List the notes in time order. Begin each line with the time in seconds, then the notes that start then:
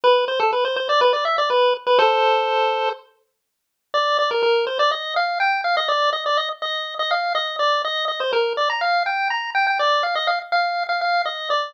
0.04 B4
0.28 C5
0.40 A4
0.53 B4
0.65 C5
0.76 C5
0.89 D5
1.01 B4
1.13 D5
1.25 E5
1.38 D5
1.50 B4
1.87 B4
1.98 A4 C5
3.94 D5
4.19 D5
4.31 A#4
4.43 A#4
4.67 C5
4.79 D5
4.91 D#5
5.16 F5
5.40 G5
5.64 F5
5.77 D#5
5.88 D5
6.13 D#5
6.26 D5
6.37 D#5
6.62 D#5
6.99 D#5
7.11 F5
7.35 D#5
7.59 D5
7.84 D#5
8.08 D#5
8.20 C5
8.33 A#4
8.57 D5
8.70 A#5
8.81 F5
9.06 G5
9.30 A#5
9.55 G5
9.67 G5
9.79 D5
10.03 F5
10.15 D#5
10.27 F5
10.52 F5
10.89 F5
11.01 F5
11.25 D#5
11.50 D5